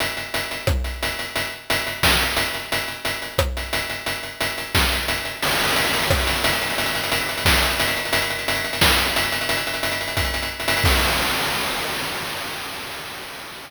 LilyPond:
\new DrumStaff \drummode { \time 4/4 \tempo 4 = 177 hh8 hh8 hh8 hh8 <bd ss>8 hh8 hh8 hh8 | hh4 hh8 hh8 <bd sn>8 hh8 hh8 hh8 | hh8 hh8 hh8 hh8 <bd ss>8 hh8 hh8 hh8 | hh8 hh8 hh8 hh8 <bd sn>8 hh8 hh8 hh8 |
cymc16 hh16 hh16 hh16 hh16 hh16 hh16 hh16 <bd ss>16 hh16 hh16 hh16 hh16 hh16 hh16 hh16 | hh16 hh16 hh16 hh16 hh16 hh16 hh16 hh16 <bd sn>16 hh16 hh16 hh16 hh16 hh16 hh16 hh16 | hh16 hh16 hh16 hh16 hh16 hh16 hh16 hh16 <bd sn>16 hh16 hh16 hh16 hh16 hh16 hh16 hh16 | hh16 hh16 hh16 hh16 hh16 hh16 hh16 hh16 <hh bd>16 hh16 hh16 hh16 r16 hh16 hh16 hh16 |
<cymc bd>4 r4 r4 r4 | }